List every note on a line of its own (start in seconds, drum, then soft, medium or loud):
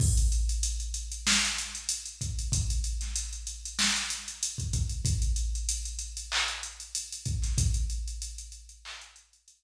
0.00 kick loud
0.00 crash loud
0.17 closed hi-hat medium
0.32 closed hi-hat medium
0.49 closed hi-hat medium
0.63 closed hi-hat loud
0.80 closed hi-hat medium
0.94 closed hi-hat medium
1.12 closed hi-hat medium
1.27 snare loud
1.45 closed hi-hat medium
1.58 closed hi-hat medium
1.75 closed hi-hat medium
1.89 closed hi-hat loud
2.06 closed hi-hat medium
2.21 kick medium
2.21 closed hi-hat medium
2.39 closed hi-hat medium
2.52 kick loud
2.52 closed hi-hat loud
2.70 closed hi-hat medium
2.84 closed hi-hat medium
3.01 snare soft
3.01 closed hi-hat medium
3.16 closed hi-hat loud
3.33 closed hi-hat medium
3.47 closed hi-hat medium
3.65 closed hi-hat medium
3.79 snare loud
3.96 closed hi-hat medium
4.10 closed hi-hat loud
4.28 closed hi-hat medium
4.43 closed hi-hat loud
4.58 kick medium
4.58 closed hi-hat medium
4.73 kick medium
4.73 closed hi-hat medium
4.89 closed hi-hat medium
5.05 kick loud
5.05 closed hi-hat loud
5.22 closed hi-hat medium
5.36 closed hi-hat medium
5.55 closed hi-hat medium
5.69 closed hi-hat loud
5.85 closed hi-hat medium
5.99 closed hi-hat medium
6.17 closed hi-hat medium
6.32 clap loud
6.48 closed hi-hat medium
6.63 closed hi-hat medium
6.80 closed hi-hat medium
6.95 closed hi-hat loud
7.13 closed hi-hat medium
7.26 kick medium
7.26 closed hi-hat medium
7.42 snare soft
7.42 closed hi-hat medium
7.58 kick loud
7.58 closed hi-hat loud
7.74 closed hi-hat medium
7.90 closed hi-hat medium
8.08 closed hi-hat medium
8.22 closed hi-hat loud
8.38 closed hi-hat medium
8.52 closed hi-hat medium
8.69 closed hi-hat medium
8.85 clap loud
9.01 closed hi-hat medium
9.16 closed hi-hat medium
9.33 closed hi-hat medium
9.48 closed hi-hat loud